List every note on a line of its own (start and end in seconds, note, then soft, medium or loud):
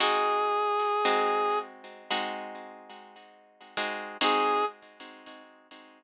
0.00 0.99 G#3 medium
0.00 0.99 C4 medium
0.00 0.99 D#4 medium
0.00 0.99 F#4 medium
0.00 1.59 G#4 medium
1.05 2.03 G#3 medium
1.05 2.03 C4 medium
1.05 2.03 D#4 medium
1.05 2.03 F#4 medium
2.11 3.63 G#3 medium
2.11 3.63 C4 medium
2.11 3.63 D#4 medium
2.11 3.63 F#4 medium
3.77 4.17 G#3 medium
3.77 4.17 C4 medium
3.77 4.17 D#4 medium
3.77 4.17 F#4 medium
4.21 4.64 G#3 medium
4.21 4.64 C4 medium
4.21 4.64 D#4 loud
4.21 4.64 F#4 loud
4.21 4.65 G#4 loud